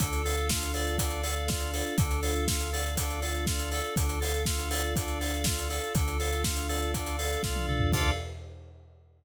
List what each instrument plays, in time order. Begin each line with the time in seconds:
0.00 synth bass 1 D2, drawbar organ D4, string ensemble 1 D4 F4 A4, electric piano 2 A4, kick, closed hi-hat
0.13 closed hi-hat
0.24 drawbar organ A4, electric piano 2 F5, open hi-hat
0.37 closed hi-hat
0.49 drawbar organ F4, electric piano 2 A4, kick, snare
0.63 closed hi-hat
0.74 drawbar organ A4, electric piano 2 D5, open hi-hat
0.87 closed hi-hat
0.98 drawbar organ D4, electric piano 2 A4, kick, closed hi-hat
1.10 closed hi-hat
1.23 drawbar organ A4, electric piano 2 F5, open hi-hat
1.36 closed hi-hat
1.48 drawbar organ F4, electric piano 2 D5, kick, snare
1.60 closed hi-hat
1.73 electric piano 2 A4, drawbar organ A4, open hi-hat
1.86 closed hi-hat
1.98 synth bass 1 D2, drawbar organ D4, string ensemble 1 D4 F4 A4, electric piano 2 A4, kick, closed hi-hat
2.11 closed hi-hat
2.22 drawbar organ A4, electric piano 2 F5, open hi-hat
2.35 closed hi-hat
2.48 drawbar organ F4, electric piano 2 A4, kick, snare
2.60 closed hi-hat
2.73 drawbar organ A4, electric piano 2 D5, open hi-hat
2.86 closed hi-hat
2.97 drawbar organ D4, electric piano 2 A4, kick, closed hi-hat
3.10 closed hi-hat
3.22 drawbar organ A4, electric piano 2 F5, open hi-hat
3.34 closed hi-hat
3.47 drawbar organ F4, electric piano 2 D5, kick, snare
3.59 closed hi-hat
3.72 drawbar organ A4, electric piano 2 A4, open hi-hat
3.84 closed hi-hat
3.96 synth bass 1 D2, string ensemble 1 D4 F4 A4, drawbar organ D4, kick, closed hi-hat
4.09 closed hi-hat
4.21 drawbar organ A4, electric piano 2 F5, open hi-hat
4.34 closed hi-hat
4.46 drawbar organ F4, electric piano 2 A4, kick, snare
4.59 closed hi-hat
4.70 drawbar organ A4, electric piano 2 D5, open hi-hat
4.83 closed hi-hat
4.96 drawbar organ D4, electric piano 2 A4, kick, closed hi-hat
5.08 closed hi-hat
5.20 drawbar organ A4, electric piano 2 F5, open hi-hat
5.34 closed hi-hat
5.44 drawbar organ F4, electric piano 2 D5, kick, snare
5.59 closed hi-hat
5.70 electric piano 2 A4, drawbar organ A4, open hi-hat
5.83 closed hi-hat
5.95 synth bass 1 D2, drawbar organ D4, string ensemble 1 D4 F4 A4, electric piano 2 A4, kick, closed hi-hat
6.08 closed hi-hat
6.19 drawbar organ A4, electric piano 2 F5, open hi-hat
6.32 closed hi-hat
6.44 drawbar organ F4, electric piano 2 A4, kick, snare
6.56 closed hi-hat
6.69 drawbar organ A4, electric piano 2 D5, open hi-hat
6.82 closed hi-hat
6.94 drawbar organ D4, electric piano 2 A4, kick, closed hi-hat
7.06 closed hi-hat
7.18 drawbar organ A4, electric piano 2 F5, open hi-hat
7.32 closed hi-hat
7.43 synth bass 1 C2, drawbar organ F4, electric piano 2 D5, kick, snare
7.56 high tom
7.68 synth bass 1 C#2, electric piano 2 A4, drawbar organ A4, mid tom
7.80 floor tom
7.92 synth bass 1 D2, drawbar organ D4 F4 A4, string ensemble 1 D4 F4 A4, electric piano 2 A4 D5 F5, kick, crash